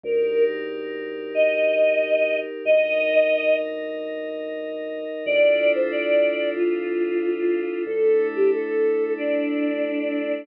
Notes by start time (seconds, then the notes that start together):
0.04 D2 D#4 G4 A#4
1.35 D#5
2.65 D2 D#4 A#4 D#5
5.26 D2 D4 E4 F4 A4 D5
5.75 C5
5.91 D5
6.56 F4
7.86 D2 A3 D4 E4 A4
8.36 G4
8.52 A4
9.17 D4